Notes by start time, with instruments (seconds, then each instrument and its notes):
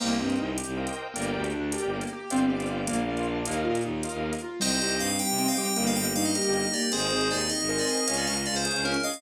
0.00 violin C2, acoustic grand piano A#3, drawbar organ A#4 C5 D#5 G5, crash
0.19 violin G2, acoustic grand piano C4, drawbar organ A#4 C5 D#5 G5
0.30 closed hi-hat
0.39 violin C2, acoustic grand piano D#4
0.58 acoustic grand piano G4, closed hi-hat
0.67 violin C2
0.77 acoustic grand piano A#3, drawbar organ A#4 C5 D#5 G5
0.87 closed hi-hat
0.97 acoustic grand piano C4
1.14 violin G1, acoustic grand piano A#3, drawbar organ A#4 D5 G5, closed hi-hat
1.33 violin D2, acoustic grand piano G4
1.44 closed hi-hat
1.54 violin D2, acoustic grand piano D4
1.72 acoustic grand piano G4, drawbar organ A#4 D5 G5, closed hi-hat
1.83 violin G1
1.93 acoustic grand piano A#3
2.01 closed hi-hat
2.13 acoustic grand piano G4
2.30 violin G1, acoustic grand piano C4, drawbar organ C5 D5 F5 G5, closed hi-hat
2.49 acoustic grand piano G4, drawbar organ C5 D5 F5 G5
2.60 closed hi-hat
2.71 acoustic grand piano F4
2.87 violin A#1, acoustic grand piano A#3, drawbar organ A#4 D5 F5, closed hi-hat
3.08 acoustic grand piano F4, drawbar organ A#4 D5 F5
3.17 closed hi-hat
3.28 acoustic grand piano D4
3.46 violin D#2, acoustic grand piano A#3, drawbar organ A#4 D#5 F5, closed hi-hat
3.64 violin A#2, acoustic grand piano F4
3.75 closed hi-hat
3.84 violin D#2, acoustic grand piano D#4
4.03 acoustic grand piano F4, drawbar organ A#4 D#5 F5, closed hi-hat
4.13 violin D#2
4.23 acoustic grand piano A#3
4.33 closed hi-hat
4.42 acoustic grand piano F4
4.60 violin C2, ocarina G3, pad 5 (bowed) C4 D#4 G4, acoustic grand piano C4, drawbar organ C5 D#5 G5, electric piano 2 C5 D#5, crash
4.71 closed hi-hat
4.80 violin C2, acoustic grand piano G4, drawbar organ C5 D#5 G5, closed hi-hat
4.91 closed hi-hat
4.99 violin G2, acoustic grand piano D#4, electric piano 2 F5, closed hi-hat
5.10 closed hi-hat
5.19 acoustic grand piano G4, electric piano 2 G5, closed hi-hat
5.29 violin C3, closed hi-hat
5.38 acoustic grand piano C4, drawbar organ C5 D#5 G5, electric piano 2 G5, closed hi-hat
5.48 electric piano 2 F5, closed hi-hat
5.57 ocarina G3, acoustic grand piano G4, electric piano 2 G5, closed hi-hat
5.68 closed hi-hat
5.76 violin G1, acoustic grand piano A#3, pad 5 (bowed) A#3 D#4 G4, drawbar organ A#4 D#5 G5, closed hi-hat
5.87 electric piano 2 F5, closed hi-hat
5.96 violin G1, acoustic grand piano G4, electric piano 2 G5, closed hi-hat
6.05 closed hi-hat
6.15 violin G2, ocarina G3, acoustic grand piano D#4, electric piano 2 F5, closed hi-hat
6.25 electric piano 2 D#5, closed hi-hat
6.35 acoustic grand piano G4, drawbar organ A#4 D#5 G5, closed hi-hat
6.44 violin G1, closed hi-hat
6.53 acoustic grand piano A#3, electric piano 2 D#5, closed hi-hat
6.64 closed hi-hat
6.73 ocarina A#3, acoustic grand piano G4, electric piano 2 D5, closed hi-hat
6.82 closed hi-hat
6.91 violin G#1, pad 5 (bowed) C4 D#4 G#4, acoustic grand piano C4, electric piano 2 G#4 C5, ocarina G#4, drawbar organ C5 D#5 G#5, closed hi-hat
7.01 closed hi-hat
7.10 violin G#1, acoustic grand piano G#4, drawbar organ C5 D#5 G#5, closed hi-hat
7.21 closed hi-hat
7.31 violin D#2, acoustic grand piano D#4, electric piano 2 D5, closed hi-hat
7.41 closed hi-hat
7.49 acoustic grand piano G#4, electric piano 2 D#5, closed hi-hat
7.60 violin G#1, closed hi-hat
7.68 acoustic grand piano C4, ocarina A#4, drawbar organ C5 D#5 G#5, electric piano 2 D#5, closed hi-hat
7.78 electric piano 2 D5, closed hi-hat
7.87 acoustic grand piano G#4, electric piano 2 D#5, closed hi-hat
7.97 closed hi-hat
8.06 violin C#2, pad 5 (bowed) C#4 F4 G#4, acoustic grand piano C#4, drawbar organ C#5 F5 G#5, closed hi-hat
8.17 electric piano 2 D5, closed hi-hat
8.26 violin C#2, acoustic grand piano G#4, electric piano 2 D#5, closed hi-hat
8.37 closed hi-hat
8.46 violin C#2, acoustic grand piano F4, electric piano 2 D5, closed hi-hat
8.56 electric piano 2 C5, closed hi-hat
8.65 acoustic grand piano G#4, drawbar organ C#5 F5 G#5, closed hi-hat
8.74 violin C#2, closed hi-hat
8.84 acoustic grand piano C#4, electric piano 2 A#4, closed hi-hat
8.94 closed hi-hat
9.03 acoustic grand piano G#4, ocarina D#5, electric piano 2 F5, closed hi-hat
9.14 open hi-hat